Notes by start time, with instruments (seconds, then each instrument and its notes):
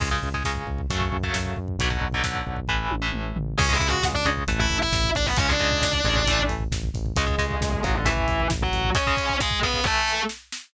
0.00 synth bass 1 C#2, overdriven guitar C#3 G#3, kick, crash
0.11 overdriven guitar C#3 G#3, kick
0.22 synth bass 1 C#2, kick
0.34 overdriven guitar C#3 G#3, kick
0.44 synth bass 1 C#2, overdriven guitar C#3 G#3, kick, snare
0.56 kick
0.67 synth bass 1 C#2, kick
0.78 kick
0.90 synth bass 1 F#2, overdriven guitar C#3 F#3 A3, kick, closed hi-hat
1.01 kick
1.12 synth bass 1 F#2, kick
1.23 overdriven guitar C#3 F#3 A3, kick
1.34 synth bass 1 F#2, kick, snare
1.46 kick
1.56 synth bass 1 F#2, kick
1.68 kick
1.78 synth bass 1 B1, overdriven guitar B2 D3 F#3, kick, closed hi-hat
1.90 overdriven guitar B2 D3 F#3, kick
2.01 synth bass 1 B1, kick
2.12 overdriven guitar B2 D3 F#3, kick
2.23 synth bass 1 B1, overdriven guitar B2 D3 F#3, kick, snare
2.34 kick
2.47 synth bass 1 B1, kick
2.56 kick
2.68 synth bass 1 A1, overdriven guitar A2 E3, kick
2.91 synth bass 1 A1, high tom
3.02 overdriven guitar A2 E3
3.12 synth bass 1 A1, mid tom
3.36 synth bass 1 A1, floor tom
3.58 synth bass 1 C#2, overdriven guitar C#3 G#3, distortion guitar C#4 C#5, kick, crash
3.69 overdriven guitar C#3 G#3, distortion guitar E4 E5, kick
3.79 synth bass 1 C#2, overdriven guitar C#3 G#3, kick, closed hi-hat
3.88 distortion guitar F#4 F#5
3.92 kick
4.03 synth bass 1 C#2, kick, snare
4.13 distortion guitar D4 D5, kick
4.25 synth bass 1 C#2, overdriven guitar C#3 G#3, kick, closed hi-hat
4.37 kick
4.47 synth bass 1 A1, overdriven guitar E3 A3, kick, closed hi-hat
4.59 distortion guitar E4 E5, kick
4.70 synth bass 1 A1, kick, closed hi-hat
4.80 distortion guitar E4 E5, kick
4.92 synth bass 1 A1, kick, snare
5.04 kick
5.15 synth bass 1 A1, distortion guitar D4 D5, kick, closed hi-hat
5.26 distortion guitar B3 B4, kick
5.36 synth bass 1 C#2, overdriven guitar C#3 G#3, distortion guitar C#4 C#5, kick, closed hi-hat
5.48 overdriven guitar C#3 G#3, distortion guitar D4 D5, kick
5.59 synth bass 1 C#2, overdriven guitar C#3 G#3, kick, closed hi-hat
5.71 kick
5.82 synth bass 1 C#2, kick, snare
5.93 kick
6.04 synth bass 1 A1, overdriven guitar C#3 G#3, kick, closed hi-hat
6.16 kick
6.26 overdriven guitar E3 A3, kick, closed hi-hat
6.39 kick
6.49 synth bass 1 A1, kick, closed hi-hat
6.60 kick
6.71 synth bass 1 A1, kick, snare
6.84 kick
6.94 synth bass 1 A1, kick, closed hi-hat
7.06 kick
7.16 synth bass 1 C#2, overdriven guitar C#3 G#3, distortion guitar G#3 G#4, kick, closed hi-hat
7.26 overdriven guitar C#3 G#3, kick
7.38 synth bass 1 C#2, overdriven guitar C#3 G#3, kick, closed hi-hat
7.51 kick
7.61 synth bass 1 C#2, kick, snare
7.73 kick
7.83 synth bass 1 A1, overdriven guitar C#3 G#3, distortion guitar F#3 F#4, kick, closed hi-hat
7.94 distortion guitar D3 D4, kick
8.05 overdriven guitar E3 A3, distortion guitar E3 E4, kick, closed hi-hat
8.17 kick
8.28 synth bass 1 A1, kick, closed hi-hat
8.40 kick
8.50 synth bass 1 A1, kick, snare
8.62 distortion guitar F#3 F#4, kick
8.72 synth bass 1 A1, kick, closed hi-hat
8.84 kick
8.95 overdriven guitar C#3 G#3, distortion guitar C#4 C#5, kick, closed hi-hat
9.07 overdriven guitar C#3 G#3, kick
9.17 overdriven guitar C#3 G#3, kick, closed hi-hat
9.30 kick
9.40 distortion guitar G#3 G#4, kick, snare
9.51 kick
9.62 overdriven guitar C#3 G#3, distortion guitar B3 B4, kick, closed hi-hat
9.74 kick
9.84 overdriven guitar E3 A3, distortion guitar A3 A4, kick, snare
10.08 snare
10.29 snare
10.52 snare